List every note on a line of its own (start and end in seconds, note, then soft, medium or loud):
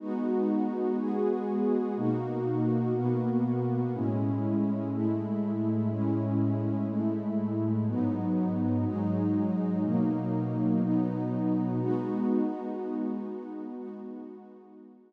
0.00 0.97 G#3 medium
0.00 0.97 B3 medium
0.00 0.97 D#4 medium
0.00 0.97 F#4 medium
0.98 1.96 G#3 medium
0.98 1.96 B3 medium
0.98 1.96 F#4 medium
0.98 1.96 G#4 medium
1.97 2.94 B2 medium
1.97 2.94 A#3 medium
1.97 2.94 D#4 medium
1.97 2.94 F#4 medium
2.95 3.92 B2 medium
2.95 3.92 A#3 medium
2.95 3.92 B3 medium
2.95 3.92 F#4 medium
3.94 4.91 A2 medium
3.94 4.91 G#3 medium
3.94 4.91 C#4 medium
3.94 4.91 E4 medium
4.92 5.89 A2 medium
4.92 5.89 G#3 medium
4.92 5.89 A3 medium
4.92 5.89 E4 medium
5.90 6.87 A2 medium
5.90 6.87 G#3 medium
5.90 6.87 C#4 medium
5.90 6.87 E4 medium
6.89 7.86 A2 medium
6.89 7.86 G#3 medium
6.89 7.86 A3 medium
6.89 7.86 E4 medium
7.87 8.84 G#2 medium
7.87 8.84 F#3 medium
7.87 8.84 B3 medium
7.87 8.84 D#4 medium
8.85 9.83 G#2 medium
8.85 9.83 F#3 medium
8.85 9.83 G#3 medium
8.85 9.83 D#4 medium
9.84 10.81 B2 medium
9.84 10.81 F#3 medium
9.84 10.81 A#3 medium
9.84 10.81 D#4 medium
10.82 11.79 B2 medium
10.82 11.79 F#3 medium
10.82 11.79 B3 medium
10.82 11.79 D#4 medium
11.80 13.75 G#3 medium
11.80 13.75 B3 loud
11.80 13.75 D#4 medium
11.80 13.75 F#4 medium
13.77 15.13 G#3 medium
13.77 15.13 B3 medium
13.77 15.13 D#4 medium
13.77 15.13 F#4 medium